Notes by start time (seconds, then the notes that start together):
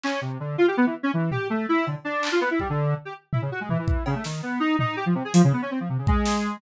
0.04 C#4, clap
0.21 C3
0.40 D3
0.58 F4
0.68 G4
0.77 B3
0.86 E3
1.03 C#4
1.14 E3
1.31 G4, floor tom
1.50 A3
1.69 E4
1.86 D3, cowbell
2.05 D4
2.23 clap
2.32 F4
2.41 B3
2.51 E4
2.60 G3, kick
2.70 D3
3.05 G4
3.33 E4, floor tom
3.42 C#3
3.52 F#4
3.61 G#3
3.69 E3, floor tom
3.79 E3
3.88 kick
4.06 C#3, cowbell
4.15 A3
4.24 D#3, snare
4.43 B3
4.60 D#4
4.79 D#4, floor tom
4.96 G4
5.06 F3
5.15 C3
5.25 G#4
5.34 F3, closed hi-hat
5.44 C#3
5.53 B3
5.62 C#4
5.71 C4
5.80 F3
5.89 C3
5.98 C#3
6.07 G#3, kick
6.25 snare